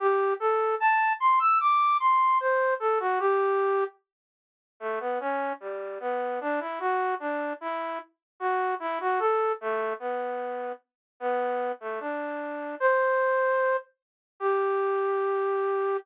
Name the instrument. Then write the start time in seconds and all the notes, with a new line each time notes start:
flute
0.00 G4
0.40 A4
0.80 A5
1.20 C6
1.40 E6
1.60 D6
2.00 C6
2.40 C5
2.80 A4
3.00 F#4
3.20 G4
4.80 A3
5.00 B3
5.20 C#4
5.60 G3
6.00 B3
6.41 D4
6.60 E4
6.80 F#4
7.20 D4
7.61 E4
8.40 F#4
8.80 E4
9.01 F#4
9.19 A4
9.61 A3
10.00 B3
11.20 B3
11.80 A3
12.00 D4
12.80 C5
14.40 G4